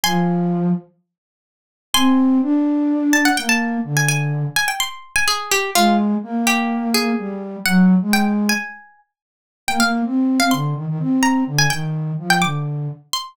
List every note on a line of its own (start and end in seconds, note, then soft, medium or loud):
0.03 0.70 F3 loud
0.03 0.73 G#5 medium
0.03 0.73 C6 medium
1.94 2.38 C4 medium
1.94 2.82 G#5 medium
1.94 2.82 C6 loud
2.42 3.28 D4 medium
3.13 3.24 A5 medium
3.25 3.37 F#5 medium
3.37 3.78 A#3 medium
3.37 3.49 G5 medium
3.49 3.84 A5 medium
3.84 4.45 D3 medium
3.97 4.08 G#5 medium
4.08 4.54 G#5 loud
4.56 4.68 G#5 medium
4.68 4.79 G5 medium
4.80 5.09 C6 medium
5.16 5.27 G#5 medium
5.28 5.49 G#4 medium
5.51 5.71 G4 medium
5.75 6.15 G#3 medium
5.75 5.97 F4 medium
6.23 7.13 A#3 medium
6.47 6.88 G4 medium
6.94 7.40 G#4 medium
7.18 7.56 G3 medium
7.65 7.95 F#3 medium
7.65 7.86 F#5 medium
8.02 8.50 G#3 medium
8.13 8.25 G5 loud
8.49 8.98 G#5 medium
9.68 9.79 A#3 medium
9.68 9.79 G5 medium
9.80 10.02 A#3 medium
9.80 9.91 F5 medium
10.05 10.39 C4 medium
10.39 10.51 C4 medium
10.39 10.51 F5 medium
10.51 10.74 D3 medium
10.51 10.74 C6 medium
10.74 10.86 D#3 medium
10.87 10.98 D#3 medium
10.99 11.42 C4 medium
11.23 11.44 A#5 medium
11.46 11.66 D3 medium
11.59 11.70 G#5 medium
11.70 12.12 D#3 medium
11.70 11.81 G5 medium
12.18 12.40 F3 medium
12.30 12.41 G5 medium
12.42 12.88 D3 medium
12.42 12.64 D6 medium
13.13 13.33 C6 medium